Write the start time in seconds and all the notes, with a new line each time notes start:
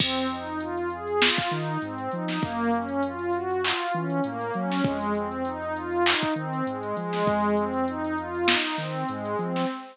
0.00 F2 C4, kick, crash
0.16 closed hi-hat
0.30 D#4, closed hi-hat
0.47 closed hi-hat
0.61 F4, closed hi-hat
0.77 closed hi-hat
0.90 G#4, closed hi-hat
1.07 closed hi-hat
1.21 F4, snare
1.38 kick, closed hi-hat
1.51 D#3 D#4, closed hi-hat
1.67 closed hi-hat
1.82 G#2 C4, closed hi-hat
1.98 closed hi-hat
2.12 F3 D#4, closed hi-hat
2.28 snare, closed hi-hat
2.42 F#2 A#3, kick, closed hi-hat
2.60 closed hi-hat
2.72 C#4, closed hi-hat
2.89 closed hi-hat
3.03 F4, closed hi-hat
3.19 closed hi-hat
3.33 F#4, closed hi-hat
3.51 closed hi-hat
3.64 F4, clap
3.80 closed hi-hat
3.94 E3 C#4, closed hi-hat
4.10 closed hi-hat
4.24 A2 A#3, closed hi-hat
4.41 closed hi-hat
4.54 F#3 C#4, closed hi-hat
4.71 snare, closed hi-hat
4.84 F2 G#3, kick, closed hi-hat
5.01 closed hi-hat
5.15 C4, closed hi-hat
5.32 closed hi-hat
5.45 D#4, closed hi-hat
5.62 closed hi-hat
5.76 F4, closed hi-hat
5.92 closed hi-hat
6.06 D#4, clap
6.23 kick, closed hi-hat
6.36 D#3 C4, closed hi-hat
6.53 closed hi-hat
6.67 G#2 G#3, closed hi-hat
6.83 closed hi-hat
6.97 F3 G#3, closed hi-hat
7.13 snare, open hi-hat
7.26 F2, kick, closed hi-hat
7.43 closed hi-hat
7.57 C4, closed hi-hat
7.74 closed hi-hat
7.88 D#4, closed hi-hat
8.04 closed hi-hat
8.18 F4, closed hi-hat
8.35 closed hi-hat
8.48 D#4, snare
8.64 closed hi-hat
8.78 D#3 C4, snare, closed hi-hat
8.95 closed hi-hat
9.09 G#2 G#3, closed hi-hat
9.25 closed hi-hat
9.39 F3 C4, closed hi-hat
9.56 snare, closed hi-hat